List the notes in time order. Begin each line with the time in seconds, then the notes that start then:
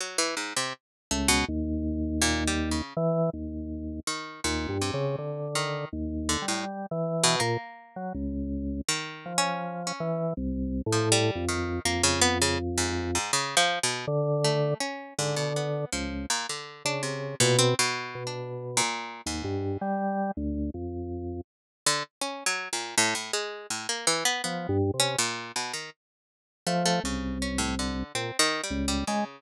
0.00 F#3
0.18 E3
0.37 G#2
0.56 C3
1.11 C#2 A3
1.28 B2
1.48 D#2
2.22 A#2
2.48 G3
2.71 C#3
2.97 E3
3.33 D#2
4.07 D#3
4.44 D#2 A#2
4.69 G2
4.81 C3
4.94 C#3
5.18 D3
5.55 D#3
5.93 D#2
6.29 D3
6.42 G3
6.48 A2
6.91 E3
7.23 B2
7.40 A#2 A#3
7.96 F#3
8.15 C#2
8.89 D#3
9.26 F3
9.38 C#4
9.87 C#4
10.00 E3
10.37 C2
10.86 A2
10.92 F3
11.12 G3
11.35 F2
11.49 D#3
11.85 F2 A#3
12.03 C#3
12.21 B3
12.42 C#3
12.78 G#2
13.15 G#2
13.33 C#3
13.57 F3
13.83 B2
14.07 D3
14.44 A3
14.80 C#4
15.19 G#2 D3
15.36 B2
15.56 B3
15.92 C#2 F3
16.30 A#2
16.49 D3
16.85 C#3 D4
17.03 C3
17.40 A#2 B2
17.59 C4
17.79 B2
18.15 B2
18.27 D4
18.77 A#2
19.26 D#2 G#2
19.44 G2
19.81 G3
20.37 D2
20.74 F2
21.86 D3
22.21 C#4
22.46 F#3
22.73 A#2
22.98 A2
23.15 A2
23.33 G#3
23.70 A2
23.89 A#3
24.07 E3
24.25 B3
24.44 F3 B3
24.69 G2
24.94 C3
25.00 C#4
25.19 A#2
25.56 B2
25.73 D#3
26.67 F3 A3
26.85 A3
27.04 C2 C#3
27.42 C#4
27.58 A2
27.79 D3
28.15 A#2 C4
28.39 D#3
28.64 G3
28.71 C#2
28.88 G3
29.07 C#3 G#3